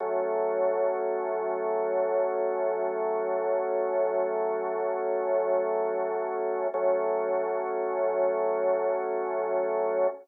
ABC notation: X:1
M:5/4
L:1/8
Q:1/4=89
K:F#dor
V:1 name="Drawbar Organ"
[F,A,C]10- | [F,A,C]10 | [F,A,C]10 |]